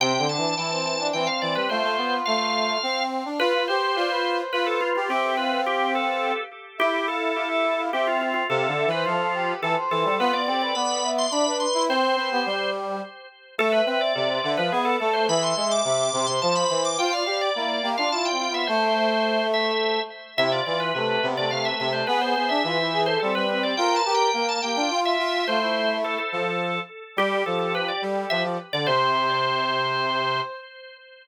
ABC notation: X:1
M:3/4
L:1/16
Q:1/4=106
K:C
V:1 name="Drawbar Organ"
g2 a6 g f d B | c4 f6 z2 | B2 c6 B A F F | G2 B2 G2 A4 z2 |
G2 A6 G F F F | A3 B F4 A z A2 | B d d d b3 c' b2 c'2 | c6 z6 |
[K:Am] A B B d4 B ^G A A c | b c' c' d'4 c' a b b d' | g f f d4 f a g g e | c6 e4 z2 |
e d d B4 d f e e c | B c c e4 c A B B d | (3g2 a2 g2 g a g g2 e3 | c4 A A5 z2 |
[K:C] G2 A A B d z2 e z2 d | c12 |]
V:2 name="Brass Section"
C C D2 E C2 D C4 | F8 z4 | B B c2 d B2 c B4 | e2 f8 z2 |
e e f2 f e2 f e4 | f2 e c A2 G2 A c3 | F2 G B d2 e2 d B3 | c2 B G5 z4 |
[K:Am] e e e2 d c e f B2 A2 | e2 e2 e2 c c c4 | c d d2 E2 G F (3E2 C2 B,2 | A,10 z2 |
E F F2 A,2 B, A, (3A,2 A,2 A,2 | ^G G G2 F E G A C2 C2 | _B2 B2 B2 G F F4 | F E5 z6 |
[K:C] G12 | c12 |]
V:3 name="Brass Section"
(3C,2 D,2 E,2 E,4 E, z E, G, | A, A, B,2 A,4 C3 D | F F G2 F4 F3 G | C10 z2 |
E8 C4 | (3C,2 D,2 E,2 F,4 E, z E, G, | B, B, C2 B,4 D3 E | C2 C B, G,4 z4 |
[K:Am] A,2 C2 C,2 D, F, B,2 A,2 | E,2 ^G,2 C,2 C, C, F,2 E,2 | F2 G2 _B,2 B, D F2 F2 | A,8 z4 |
C,2 E,2 C,2 C, C, C,2 C,2 | B,2 B, D E,4 G, G,3 | F2 G2 _B,2 B, D F2 F2 | A,6 F,4 z2 |
[K:C] G,2 F,4 G,2 F, F, z D, | C,12 |]